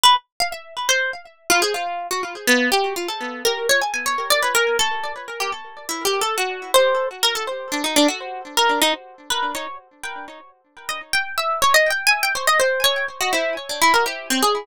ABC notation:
X:1
M:3/4
L:1/16
Q:1/4=123
K:none
V:1 name="Orchestral Harp"
B z2 f e2 z c2 z3 | F ^G F3 ^F z2 B,2 =G2 | F A3 ^A2 ^c ^g g c2 d | B ^A2 =A3 z2 G z3 |
(3E2 G2 A2 ^F3 c3 z ^A | A z2 D ^D =D ^F3 z ^A2 | ^D z3 B2 ^c2 z2 g2 | z5 ^d z g2 e2 ^c |
(3^d2 g2 ^g2 =g c d c2 ^c2 z | ^F E2 z D E ^A G2 C ^G2 |]